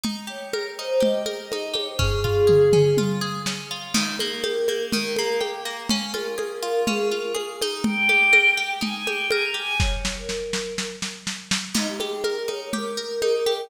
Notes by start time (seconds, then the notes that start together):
0.04 D#4, low conga
0.27 G4 C#5
0.53 A#4, high conga
0.77 D#4 C5
1.00 G4 D#5, low conga
1.26 A#4, high conga
1.52 D#4, high conga
1.74 G4 C#5, high conga
1.88 C5
1.99 C#4 G#4, kick, floor tom
2.24 F4, floor tom
2.47 G#4, mid tom
2.73 C#4, mid tom
2.97 F4, high tom
3.21 G#4
3.46 C#4, snare
3.71 F4
3.94 D#3, crash, low conga
4.19 A#3 A#4, high conga
4.44 G4, high conga
4.68 A#3, high conga
4.92 D#3 A#4, low conga
5.16 A#3 A#4, high conga
5.41 G4, high conga
5.65 A#3
5.89 C#4, low conga
6.14 F4 A#4, high conga
6.38 G#4, high conga
6.63 F4
6.87 C#4 G#4, low conga
7.11 F4 A#4
7.35 G#4, high conga
7.61 D#4, high conga
7.84 G5, low conga
8.09 G4, high conga
8.33 A#4, high conga
8.57 G4
8.81 D#4 G#5, low conga
8.95 G#5
9.07 G4 G5, high conga
9.31 A#4 G#5, high conga
9.44 A#5
9.54 G4 G#5
9.80 C#5, kick, snare
10.05 snare
10.17 A#4
10.29 snare
10.53 snare
10.78 snare
11.02 snare
11.27 snare
11.51 snare
11.74 D#4, crash, low conga
11.88 G4
12.00 G4 G#4, high conga
12.24 A#4, high conga
12.48 D#4 C#5, high conga
12.61 C#5
12.73 G4 A#4, low conga
12.97 A#4
13.22 D#4, high conga
13.46 G4, high conga